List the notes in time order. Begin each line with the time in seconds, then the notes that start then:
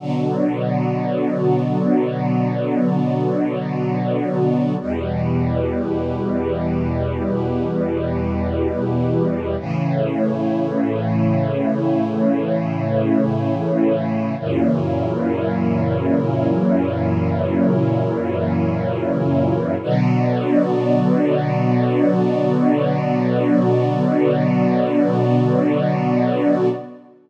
0.00 B2 D3 F#3 B3 F#4 D5
4.80 E2 B2 G3 E4 G4 B4
9.60 A2 C#3 E3 A3 E4 C#5
14.39 F#2 A#2 C#3 E3 F#3 E4 A#4 C#5
19.82 B2 D3 F#3 B3 F#4 D5